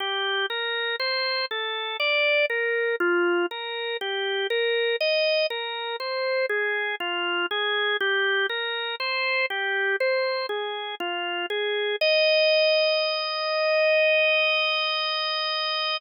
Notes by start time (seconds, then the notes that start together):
0.00 G4
0.50 A#4
1.00 C5
1.51 A4
2.00 D5
2.50 A#4
3.00 F4
3.51 A#4
4.01 G4
4.50 A#4
5.00 D#5
5.50 A#4
6.00 C5
6.49 G#4
7.00 F4
7.51 G#4
8.00 G4
8.49 A#4
9.00 C5
9.50 G4
10.00 C5
10.49 G#4
11.00 F4
11.50 G#4
12.01 D#5